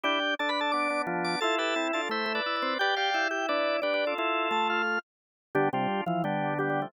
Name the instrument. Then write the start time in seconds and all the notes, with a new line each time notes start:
drawbar organ
0.04 D4 E4 G4 G5
0.39 D4 A4 A5
0.49 B4 B5
0.61 A4 A5
0.72 B3 D4 D5 D6
0.90 B3 D4
1.07 F3 B3 D4
1.24 D5 D6
1.41 E4 F4 A4 A5
1.58 G4 A4 B4 A5
1.76 C4 E4
1.93 D4 F4 A4 A5
2.09 A3 E4 C5 E5
2.26 A3
2.35 B4 D5
2.46 E4 E5
2.56 B4 D5
2.62 C4
2.79 G4 B4 D5 G5
2.96 G4 D5 F5 G5
3.14 E4
3.31 G4 G5
3.48 D4 B4 D5
3.82 D4 G4 B4 D5
3.94 G4 B4
4.07 F4 A4
4.18 E4 F4 A4
4.51 A3 A4 A5
4.70 F4 F5
5.55 D3 G3 B3 D4 G4
5.73 C3 G3 D4 F4 G4
6.06 E3 F3 F4
6.24 D3 G3 B3 D4 G4
6.59 G3 B3 G4
6.70 G3 B3
6.82 F3 A3